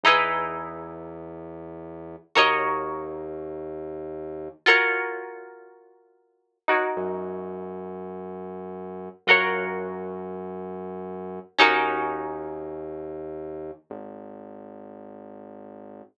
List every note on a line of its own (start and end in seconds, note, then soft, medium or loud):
0.03 2.16 E2 medium
0.03 2.31 D#4 medium
0.03 2.31 E4 medium
0.03 2.31 G#4 medium
0.08 2.31 B4 medium
2.35 4.48 D#2 loud
2.35 4.61 F#4 medium
2.35 4.61 A#4 medium
2.35 4.61 C#5 medium
2.35 4.61 D#5 medium
4.66 6.58 F4 medium
4.66 6.58 F#4 medium
4.66 6.58 A#4 medium
4.66 6.58 C#5 medium
6.68 9.23 D#4 medium
6.68 9.23 F#4 medium
6.68 9.23 A#4 medium
6.68 9.23 C#5 medium
6.96 9.09 F#2 medium
9.27 11.39 F#2 loud
9.27 11.54 F4 medium
9.27 11.54 F#4 medium
9.27 11.54 A#4 medium
9.27 11.54 C#5 medium
11.58 13.71 D#2 loud
11.58 13.84 C#4 medium
11.58 13.84 D#4 medium
11.58 13.84 F#4 medium
11.58 13.84 A#4 medium
13.90 16.02 G#1 medium